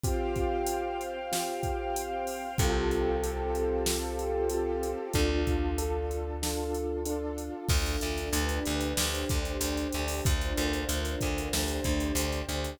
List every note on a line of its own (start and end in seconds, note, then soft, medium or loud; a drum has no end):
0.03 1.19 C4 medium
0.03 1.19 F4 medium
0.03 1.19 G4 medium
0.03 2.57 C5 medium
0.03 2.57 F5 loud
0.03 2.57 G5 medium
0.03 kick loud
0.03 closed hi-hat loud
0.36 kick medium
0.36 closed hi-hat medium
0.66 closed hi-hat loud
1.01 closed hi-hat medium
1.32 2.47 C4 medium
1.32 2.47 F4 medium
1.32 2.47 G4 medium
1.32 snare loud
1.63 kick medium
1.63 closed hi-hat medium
1.96 closed hi-hat loud
2.27 open hi-hat medium
2.58 4.94 C2 medium
2.58 5.12 C4 medium
2.58 3.17 C4 medium
2.58 5.12 F4 medium
2.58 3.17 F4 medium
2.58 5.12 G4 medium
2.58 3.17 G4 medium
2.58 5.12 A4 medium
2.58 3.17 A4 medium
2.58 kick loud
2.58 closed hi-hat loud
2.91 closed hi-hat medium
3.23 3.80 C4 medium
3.23 3.80 F4 medium
3.23 3.80 G4 medium
3.23 3.80 A4 medium
3.23 closed hi-hat medium
3.55 closed hi-hat medium
3.86 4.45 C4 medium
3.86 4.45 F4 medium
3.86 4.45 G4 medium
3.86 4.45 A4 medium
3.86 snare loud
4.19 closed hi-hat medium
4.49 5.08 C4 medium
4.49 5.08 F4 medium
4.49 5.08 G4 medium
4.49 5.08 A4 medium
4.49 closed hi-hat medium
4.83 closed hi-hat medium
5.13 7.50 D2 medium
5.13 5.72 D4 medium
5.13 5.72 F4 medium
5.13 5.72 A4 medium
5.13 kick medium
5.13 closed hi-hat medium
5.47 kick medium
5.47 closed hi-hat medium
5.78 6.36 D4 medium
5.78 6.36 F4 medium
5.78 6.36 A4 medium
5.78 closed hi-hat loud
6.11 closed hi-hat medium
6.42 7.00 D4 medium
6.42 7.00 F4 medium
6.42 7.00 A4 medium
6.42 snare loud
6.74 closed hi-hat medium
7.05 7.63 D4 medium
7.05 7.63 F4 medium
7.05 7.63 A4 medium
7.05 closed hi-hat medium
7.38 closed hi-hat medium
7.69 7.97 D2 medium
7.69 8.33 D4 medium
7.69 8.33 F4 medium
7.69 8.33 A4 medium
7.69 kick loud
7.69 crash loud
7.86 closed hi-hat medium
8.01 8.30 D2 medium
8.01 closed hi-hat medium
8.18 closed hi-hat medium
8.33 8.60 D2 medium
8.33 8.97 D4 medium
8.33 8.97 G4 medium
8.33 8.97 B4 medium
8.33 closed hi-hat loud
8.49 closed hi-hat medium
8.65 8.94 D2 medium
8.65 closed hi-hat medium
8.81 closed hi-hat medium
8.97 9.25 D2 medium
8.97 10.23 D4 medium
8.97 10.23 G4 medium
8.97 10.23 C5 medium
8.97 snare loud
9.15 closed hi-hat medium
9.29 9.57 D2 medium
9.29 kick medium
9.29 closed hi-hat medium
9.45 closed hi-hat medium
9.61 9.88 D2 medium
9.61 closed hi-hat loud
9.77 closed hi-hat medium
9.92 10.21 D2 medium
9.92 closed hi-hat medium
10.08 open hi-hat medium
10.25 10.53 D2 medium
10.25 11.52 D4 medium
10.25 11.52 F4 medium
10.25 11.52 A#4 medium
10.25 11.52 C5 medium
10.25 kick loud
10.25 closed hi-hat loud
10.41 closed hi-hat medium
10.57 10.85 D2 medium
10.57 closed hi-hat medium
10.73 closed hi-hat medium
10.89 11.16 D2 medium
10.89 closed hi-hat loud
11.05 closed hi-hat medium
11.21 11.49 D2 medium
11.21 kick medium
11.21 closed hi-hat medium
11.38 closed hi-hat medium
11.52 11.80 D2 medium
11.52 12.79 D4 medium
11.52 12.79 G4 medium
11.52 12.79 C5 medium
11.52 snare loud
11.68 closed hi-hat medium
11.84 12.12 D2 medium
11.84 kick medium
11.84 closed hi-hat medium
12.00 closed hi-hat medium
12.15 12.42 D2 medium
12.15 closed hi-hat loud
12.32 closed hi-hat medium
12.49 12.76 D2 medium
12.49 closed hi-hat medium
12.64 closed hi-hat medium